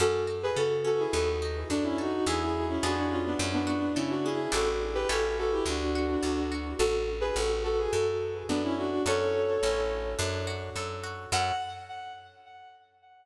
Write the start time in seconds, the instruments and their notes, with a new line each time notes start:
0.00 electric bass (finger) F#2, orchestral harp C#4, violin F#4 A4
0.27 orchestral harp F#4
0.43 violin G#4 B4
0.56 electric bass (finger) C#3, violin F#4 A4, orchestral harp A4
0.85 orchestral harp C#4, violin F#4 A4
0.99 violin E4 G#4
1.13 electric bass (finger) D#2, orchestral harp B3, violin F#4 A4
1.42 orchestral harp D#4
1.70 electric bass (finger) F#2, violin D4, orchestral harp F#4
1.84 violin C#4 E4
1.98 violin D#4 F#4, orchestral harp A4
2.26 electric bass (finger) E2, orchestral harp B3 E4 G#4, violin E4 G#4
2.41 violin E4 G#4
2.69 violin C#4 E4
2.83 electric bass (finger) F2, orchestral harp B3 D4 F4 G#4, violin D4 F#4
2.97 violin D4 F#4
3.10 violin C#4 F4
3.25 violin B3 D4
3.39 electric bass (finger) F#2, orchestral harp C#4
3.53 violin B3 D4
3.67 orchestral harp F#4
3.95 electric bass (finger) C#3, violin C#4 E4, orchestral harp A4
4.10 violin D4 F#4
4.24 orchestral harp C#4, violin E4 G#4
4.52 electric bass (finger) A1, orchestral harp D4 E4 G4 A4, violin F#4 A4
4.95 violin G4 B4
5.09 electric bass (finger) A1, orchestral harp C#4 E4 G4 A4, violin F#4 A4
5.38 violin F#4 A4
5.52 violin E4 G4
5.66 electric bass (finger) D2, violin D4 F#4, orchestral harp D4
5.95 orchestral harp F#4
6.23 electric bass (finger) D2, orchestral harp A4
6.52 orchestral harp F#4
6.79 electric bass (finger) A1, violin F#4 A4
7.21 violin G#4 B4
7.36 electric bass (finger) A1, violin F#4 A4
7.64 violin F#4 A4
7.78 violin G#4
7.93 electric bass (finger) F#2, violin F#4 A4
8.49 electric bass (finger) F#2, violin B3 D4
8.64 violin C#4 E4
8.77 violin D4 F#4
9.06 electric bass (finger) F#2, orchestral harp C#4 F#4 A4, violin A4 C#5
9.63 electric bass (finger) A1, orchestral harp C#4 E4 A4
10.19 electric bass (finger) F#2, orchestral harp D4
10.47 orchestral harp F#4
10.76 electric bass (finger) F#2, orchestral harp A4
11.04 orchestral harp F#4
11.32 electric bass (finger) F#2, orchestral harp C#4 F#4 A4, violin F#5